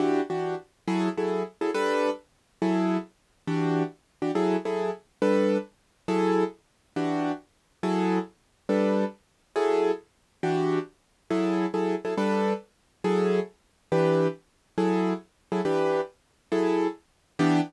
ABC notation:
X:1
M:4/4
L:1/8
Q:"Swing" 1/4=138
K:Edor
V:1 name="Acoustic Grand Piano"
[E,DFG] [E,DFG]3 [F,E^GA] [F,EGA]2 [F,EGA] | [G,DAB]4 [F,E^GA]4 | [E,DFG]3 [E,DFG] [F,E^GA] [F,EGA]3 | [G,DAB]4 [F,E^GA]4 |
[E,DFG]4 [F,E^GA]4 | [G,DAB]4 [F,E^GA]4 | [E,DFG]4 [F,E^GA]2 [F,EGA] [F,EGA] | [G,DAB]4 [F,E^GA]4 |
[E,DGB]4 [F,E^GA]3 [F,EGA] | [E,DGB]4 [F,E^GA]4 | [E,B,DG]2 z6 |]